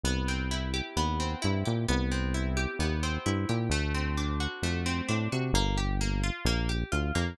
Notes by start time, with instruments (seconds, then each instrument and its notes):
0.03 synth bass 1 C2, acoustic guitar (steel) B3
0.28 acoustic guitar (steel) C4
0.51 acoustic guitar (steel) E4
0.74 acoustic guitar (steel) G4
0.96 synth bass 1 D#2, acoustic guitar (steel) B3
1.20 acoustic guitar (steel) C4
1.42 synth bass 1 G2, acoustic guitar (steel) E4
1.65 synth bass 1 A#2, acoustic guitar (steel) G4
1.88 synth bass 1 C2, acoustic guitar (steel) B3
2.11 acoustic guitar (steel) C4
2.34 acoustic guitar (steel) E4
2.57 acoustic guitar (steel) G4
2.79 synth bass 1 D#2, acoustic guitar (steel) B3
3.03 acoustic guitar (steel) C4
3.26 synth bass 1 G2, acoustic guitar (steel) E4
3.49 synth bass 1 A#2, acoustic guitar (steel) G4
3.70 synth bass 1 D2, acoustic guitar (steel) A3
3.94 acoustic guitar (steel) C4
4.17 acoustic guitar (steel) D4
4.40 acoustic guitar (steel) F#4
4.62 synth bass 1 F2, acoustic guitar (steel) A3
4.86 acoustic guitar (steel) C4
5.08 synth bass 1 A2, acoustic guitar (steel) D4
5.32 synth bass 1 C3, acoustic guitar (steel) F#4
5.53 synth bass 1 G1, acoustic guitar (steel) A#3
5.77 acoustic guitar (steel) G4
6.01 acoustic guitar (steel) A#3
6.23 acoustic guitar (steel) F4
6.45 synth bass 1 A#1, acoustic guitar (steel) A#3
6.69 acoustic guitar (steel) G4
6.92 synth bass 1 D2, acoustic guitar (steel) F4
7.15 synth bass 1 F2, acoustic guitar (steel) A#3